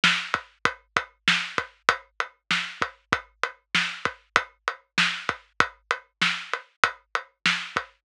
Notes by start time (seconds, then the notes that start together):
0.04 snare
0.34 kick, closed hi-hat
0.65 kick, closed hi-hat
0.96 kick, closed hi-hat
1.28 snare
1.58 kick, closed hi-hat
1.89 kick, closed hi-hat
2.20 closed hi-hat
2.51 snare
2.82 kick, closed hi-hat
3.13 kick, closed hi-hat
3.43 closed hi-hat
3.75 snare
4.05 kick, closed hi-hat
4.36 kick, closed hi-hat
4.68 closed hi-hat
4.98 snare
5.29 kick, closed hi-hat
5.60 kick, closed hi-hat
5.91 closed hi-hat
6.22 snare
6.53 closed hi-hat
6.84 kick, closed hi-hat
7.15 closed hi-hat
7.46 snare
7.76 kick, closed hi-hat